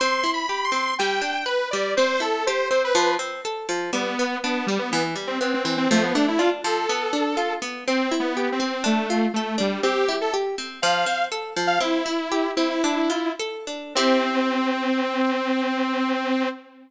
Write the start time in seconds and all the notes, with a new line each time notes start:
0.00 C4 C6
0.24 E4
0.34 B5
0.49 G4
0.64 C6
0.72 C4
0.99 G3 G5
1.22 D4
1.46 B4
1.71 G3 D5
1.97 C4 C5
2.20 E4 A4
2.47 G4 C5
2.70 C4 C5
2.84 B4
2.95 F3
3.19 C4
3.45 A4
3.69 F3
3.93 G3 B3
4.19 B3
4.43 B3 D4
4.67 G3
4.79 B3
4.91 E3 B3
5.15 G3
5.27 C4
5.41 B3 C4
5.54 C4
5.64 E3 C4
5.77 C4
5.91 F3 A3
6.03 B3
6.15 A3 D4
6.28 E4
6.38 D4 F4
6.64 F3 A4
6.89 B3
7.13 D4
7.37 F4
7.62 B3
7.88 C4
8.11 E4
8.20 B3
8.37 G4
8.52 C4
8.60 C4
8.84 A3 D4
9.10 F4
9.34 A3 A4
9.58 G3 D4
9.83 C4 G4
10.09 E4
10.21 A4
10.34 G4
10.58 C4
10.82 F3 F5
11.06 C4
11.32 A4
11.56 F3
11.67 F5
11.80 C4 E4
12.06 E4
12.32 G4
12.56 C4 E4
12.70 E4
12.84 D4
13.10 F4
13.40 A4
13.67 D4
13.95 C4 E4 G4